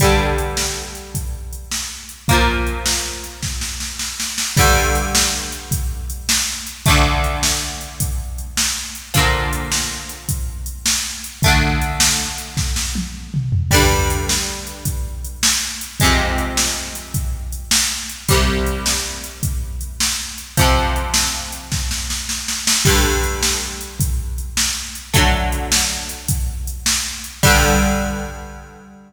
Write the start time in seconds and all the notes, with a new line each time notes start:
0.00 D3 G3, kick, closed hi-hat
0.04 G2
0.38 closed hi-hat
0.57 snare
0.95 closed hi-hat
1.15 kick, closed hi-hat
1.53 closed hi-hat
1.71 snare
2.09 closed hi-hat
2.28 F3 A#3, kick, closed hi-hat
2.33 A#2
2.67 closed hi-hat
2.86 snare
3.24 closed hi-hat
3.43 kick, snare
3.61 snare
3.80 snare
3.99 snare
4.20 snare
4.38 snare
4.57 D3 G3, kick, crash
4.61 G2
4.95 closed hi-hat
5.15 snare
5.52 closed hi-hat
5.71 kick, closed hi-hat
6.10 closed hi-hat
6.29 snare
6.67 closed hi-hat
6.86 D3 A3, kick, closed hi-hat
6.90 D2
7.24 closed hi-hat
7.43 snare
7.81 closed hi-hat
8.00 kick, closed hi-hat
8.38 closed hi-hat
8.57 snare
8.95 closed hi-hat
9.14 A#2 D3 F3, kick, closed hi-hat
9.53 closed hi-hat
9.72 snare
10.09 closed hi-hat
10.29 kick, closed hi-hat
10.66 closed hi-hat
10.86 snare
11.24 closed hi-hat
11.42 D3 A3, kick, closed hi-hat
11.48 D2
11.82 closed hi-hat
12.00 snare
12.38 closed hi-hat
12.57 kick, snare
12.76 snare
12.95 high tom
13.34 mid tom
13.52 floor tom
13.71 G2 D3 G3, kick, crash
14.10 closed hi-hat
14.29 snare
14.67 closed hi-hat
14.85 kick, closed hi-hat
15.25 closed hi-hat
15.43 snare
15.81 closed hi-hat
16.00 C3 G#3, kick, closed hi-hat
16.05 F2
16.38 closed hi-hat
16.57 snare
16.95 closed hi-hat
17.14 kick, closed hi-hat
17.52 closed hi-hat
17.71 snare
18.09 closed hi-hat
18.28 C2 C3 G3, kick, closed hi-hat
18.66 closed hi-hat
18.86 snare
19.24 closed hi-hat
19.43 kick, closed hi-hat
19.81 closed hi-hat
20.00 snare
20.38 closed hi-hat
20.57 F2 C3 F3, kick, closed hi-hat
20.96 closed hi-hat
21.14 snare
21.52 closed hi-hat
21.72 kick, snare
21.91 snare
22.10 snare
22.29 snare
22.48 snare
22.67 snare
22.85 G2 D3 G3, kick, crash
23.23 closed hi-hat
23.43 snare
23.81 closed hi-hat
24.00 kick, closed hi-hat
24.38 closed hi-hat
24.57 snare
24.95 closed hi-hat
25.14 D3 F#3 A3, kick, closed hi-hat
25.52 closed hi-hat
25.72 snare
26.09 closed hi-hat
26.28 kick, closed hi-hat
26.67 closed hi-hat
26.86 snare
27.24 closed hi-hat
27.43 G2 D3 G3, kick, crash